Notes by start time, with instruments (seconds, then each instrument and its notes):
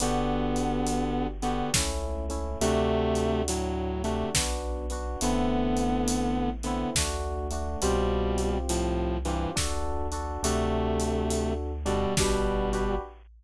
0.00 synth bass 1 G1, distortion guitar D3 B3, electric piano 1 B3 D4 F#4 G4, closed hi-hat
0.56 closed hi-hat
0.87 closed hi-hat
1.42 distortion guitar D3 B3, electric piano 1 B3 D4 F#4 G4, closed hi-hat
1.74 synth bass 1 C#2, electric piano 1 A3 C#4 E4, kick, snare
2.29 electric piano 1 A3 C#4 E4, closed hi-hat
2.61 synth bass 1 D2, distortion guitar C3 A3, electric piano 1 A3 D4 F#4, closed hi-hat
3.15 closed hi-hat
3.48 distortion guitar A2 F#3, closed hi-hat
4.04 distortion guitar C3 A3, electric piano 1 A3 D4 F#4, closed hi-hat
4.35 synth bass 1 B1, electric piano 1 B3 D4 F#4, kick, snare
4.90 electric piano 1 B3 D4 F#4, closed hi-hat
5.21 synth bass 1 A1, distortion guitar D3 B3, electric piano 1 A3 B3 C4 E4, closed hi-hat
5.77 closed hi-hat
6.08 closed hi-hat
6.63 distortion guitar D3 B3, electric piano 1 A3 B3 C4 E4, closed hi-hat
6.95 synth bass 1 D2, electric piano 1 A3 D4 F#4, kick, snare
7.51 electric piano 1 A3 D4 F#4, closed hi-hat
7.82 synth bass 1 C2, distortion guitar B2 G3, electric piano 1 C4 F4 G4, closed hi-hat
8.38 closed hi-hat
8.69 distortion guitar A2 F3, closed hi-hat
9.25 distortion guitar G2 E3, electric piano 1 C4 F4 G4, closed hi-hat
9.56 synth bass 1 D2, electric piano 1 D4 F#4 A4, kick, snare
10.12 electric piano 1 D4 F#4 A4, closed hi-hat
10.43 synth bass 1 D2, distortion guitar C3 A3, electric piano 1 D4 F#4 A4, closed hi-hat
11.00 closed hi-hat
11.30 closed hi-hat
11.86 distortion guitar B2 G3, electric piano 1 D4 F#4 A4, closed hi-hat
12.17 synth bass 1 G1, distortion guitar B2 G3, electric piano 1 D4 F#4 G4 B4, kick, snare
12.72 electric piano 1 D4 F#4 G4 B4, closed hi-hat